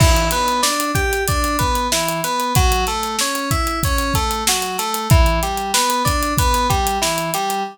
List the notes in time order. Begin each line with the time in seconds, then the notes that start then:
0.00 E3, kick, crash
0.16 closed hi-hat
0.31 B3, closed hi-hat
0.48 closed hi-hat
0.63 D4, snare
0.80 closed hi-hat
0.95 G4, kick, closed hi-hat
1.13 closed hi-hat
1.28 D4, kick, closed hi-hat
1.44 closed hi-hat
1.59 B3, kick, closed hi-hat
1.75 closed hi-hat
1.92 E3, snare
2.09 closed hi-hat
2.24 B3, closed hi-hat
2.40 closed hi-hat
2.55 F#3, kick, closed hi-hat
2.72 closed hi-hat
2.87 A3, closed hi-hat
3.03 closed hi-hat
3.19 C#4, snare
3.35 closed hi-hat
3.51 E4, kick, closed hi-hat
3.67 closed hi-hat
3.83 C#4, kick, closed hi-hat
3.98 closed hi-hat
4.14 A3, kick, closed hi-hat
4.31 closed hi-hat
4.47 F#3, snare
4.62 snare, closed hi-hat
4.78 A3, snare, closed hi-hat
4.94 closed hi-hat
5.10 E3, kick, closed hi-hat
5.26 closed hi-hat
5.43 G3, closed hi-hat
5.57 closed hi-hat
5.74 B3, snare
5.90 closed hi-hat
6.05 D4, kick, snare, closed hi-hat
6.23 closed hi-hat
6.38 B3, kick, closed hi-hat
6.54 snare, closed hi-hat
6.70 G3, kick, closed hi-hat
6.87 closed hi-hat
7.02 E3, snare
7.18 closed hi-hat
7.34 G3, closed hi-hat
7.50 closed hi-hat